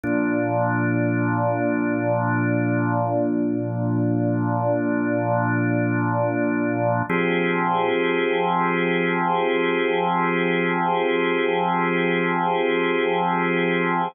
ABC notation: X:1
M:3/4
L:1/8
Q:1/4=51
K:Fdor
V:1 name="Drawbar Organ"
[B,,F,D]6- | [B,,F,D]6 | [F,CGA]6- | [F,CGA]6 |]